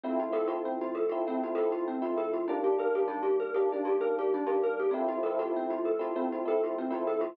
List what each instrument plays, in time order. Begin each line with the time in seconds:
0.03 electric piano 1 F3 A3 C4 E4, kalimba C4
0.20 kalimba F4
0.32 electric piano 1 F3 A3 C4 E4, kalimba A4
0.47 electric piano 1 F3 A3 C4 E4, kalimba F4
0.65 kalimba C4
0.81 kalimba F4
0.95 kalimba A4
1.09 electric piano 1 F3 A3 C4 E4, kalimba F4
1.27 electric piano 1 F3 A3 C4 E4, kalimba C4
1.43 kalimba F4
1.55 electric piano 1 F3 A3 C4 E4, kalimba A4
1.72 kalimba F4
1.88 kalimba C4
2.02 electric piano 1 F3 A3 C4 E4, kalimba F4
2.17 kalimba A4
2.33 kalimba F4
2.48 electric piano 1 D#3 G3 A#3 D4, kalimba D4
2.64 kalimba G4
2.78 electric piano 1 D#3 G3 A#3 D4, kalimba A#4
2.95 electric piano 1 D#3 G3 A#3 D4, kalimba G4
3.08 kalimba D4
3.23 kalimba G4
3.40 kalimba A#4
3.54 electric piano 1 D#3 G3 A#3 D4, kalimba G4
3.72 electric piano 1 D#3 G3 A#3 D4, kalimba D4
3.85 kalimba G4
4.00 electric piano 1 D#3 G3 A#3 D4, kalimba A#4
4.19 kalimba G4
4.34 kalimba D4
4.47 electric piano 1 D#3 G3 A#3 D4, kalimba G4
4.63 kalimba A#4
4.79 kalimba G4
4.91 electric piano 1 F3 A3 C4 E4, kalimba C4
5.08 kalimba F4
5.23 electric piano 1 F3 A3 C4 E4, kalimba A4
5.39 electric piano 1 F3 A3 C4 E4, kalimba F4
5.56 kalimba C4
5.70 kalimba F4
5.85 kalimba A4
5.99 electric piano 1 F3 A3 C4 E4, kalimba F4
6.15 electric piano 1 F3 A3 C4 E4, kalimba C4
6.32 kalimba F4
6.45 electric piano 1 F3 A3 C4 E4, kalimba A4
6.64 kalimba F4
6.78 kalimba C4
6.90 electric piano 1 F3 A3 C4 E4, kalimba F4
7.07 kalimba A4
7.21 kalimba F4